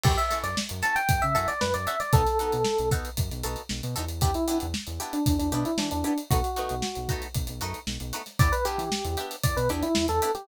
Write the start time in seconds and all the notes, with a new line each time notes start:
0.03 F#2 C#4 E4 F#4 G4 A4, kick, crash
0.17 E5, closed hi-hat
0.31 C#4 E4 F#4 A4, snare, closed hi-hat
0.43 F#2 D5, snare, closed hi-hat
0.57 snare
0.69 F#2, closed hi-hat
0.82 C#4 E4 F#4 A4 A5, snare, closed hi-hat
0.96 G5, closed hi-hat
1.09 F#2, kick, closed hi-hat
1.22 C#3 E5, closed hi-hat
1.35 F#2 C#4 E4 F#4 A4 E5, closed hi-hat
1.48 D5, snare, closed hi-hat
1.61 F#2 B4, snare
1.74 F#2 D5, closed hi-hat
1.87 C#4 E4 F#4 A4 E5, closed hi-hat
2.00 D5, snare, closed hi-hat
2.13 B1 B3 D#4 F#4 A4, kick, closed hi-hat
2.26 snare, closed hi-hat
2.39 B3 D#4 F#4 A4, closed hi-hat
2.52 B2, closed hi-hat
2.65 snare
2.78 B1, closed hi-hat
2.91 B3 D#4 F#4 A4, kick, closed hi-hat
3.05 closed hi-hat
3.17 F#2, kick, closed hi-hat
3.31 B1, snare, closed hi-hat
3.43 B1 B3 D#4 F#4 A4, closed hi-hat
3.56 closed hi-hat
3.69 B1, snare
3.83 B2, closed hi-hat
3.96 E2 B3 D#4 F#4 A4, closed hi-hat
4.09 closed hi-hat
4.21 B3 D4 E4 G4, kick, closed hi-hat
4.34 E4, closed hi-hat
4.48 B3 D4 E4 G4, closed hi-hat
4.60 E2, closed hi-hat
4.74 snare
4.87 E2, closed hi-hat
5.00 B3 D4 E4 G4, closed hi-hat
5.13 D4, closed hi-hat
5.26 E2, kick, closed hi-hat
5.39 E2 D4, closed hi-hat
5.52 B2 B3 D4 E4 G4, closed hi-hat
5.65 E4, closed hi-hat
5.78 E3 D4, snare
5.91 E2 D4, closed hi-hat
6.04 B3 D4 E4 G4, closed hi-hat
6.18 closed hi-hat
6.31 B1 A3 B3 D#4 F#4, kick, closed hi-hat
6.44 closed hi-hat
6.56 A3 B3 D#4 F#4, closed hi-hat
6.69 B1, closed hi-hat
6.82 snare
6.95 B1, closed hi-hat
7.09 A3 B3 D#4 F#4, kick, closed hi-hat
7.22 closed hi-hat
7.35 B1, kick, closed hi-hat
7.47 B1, closed hi-hat
7.61 F#2 A3 B3 D#4 F#4, closed hi-hat
7.74 closed hi-hat
7.87 B1, snare
8.00 B1, closed hi-hat
8.13 A3 B3 D#4 F#4, closed hi-hat
8.26 snare, closed hi-hat
8.39 E2 B3 D4 E4 G4 D5, kick, closed hi-hat
8.52 B4, closed hi-hat
8.65 B3 D4 E4 G4, closed hi-hat
8.78 E3, closed hi-hat
8.92 snare
9.05 E2, closed hi-hat
9.17 B3 D4 E4 G4, closed hi-hat
9.31 closed hi-hat
9.43 E2 D5, kick, closed hi-hat
9.57 B2 B4, closed hi-hat
9.69 E2 B3 D4 E4 G4, closed hi-hat
9.83 E4, closed hi-hat
9.95 E2, snare
10.08 E2 A4, snare, closed hi-hat
10.22 B3 D4 E4 G4, closed hi-hat
10.35 G4, snare, closed hi-hat